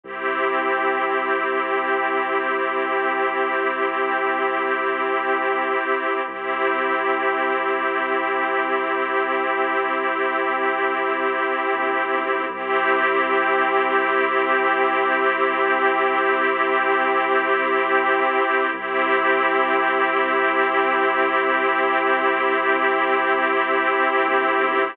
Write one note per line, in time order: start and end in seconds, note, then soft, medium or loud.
0.03 5.78 C2 medium
0.03 6.21 C4 medium
0.03 6.21 E4 medium
0.03 6.21 G4 medium
6.27 11.46 C2 medium
6.27 12.44 C4 medium
6.27 12.44 E4 medium
6.27 12.44 G4 medium
11.72 12.07 A#1 medium
12.12 12.47 B1 medium
12.50 18.23 C2 loud
12.50 18.67 C4 medium
12.50 18.67 E4 medium
12.50 18.67 G4 medium
18.73 23.92 C2 loud
18.73 24.90 C4 medium
18.73 24.90 E4 medium
18.73 24.90 G4 medium
24.20 24.55 A#1 medium
24.58 24.93 B1 medium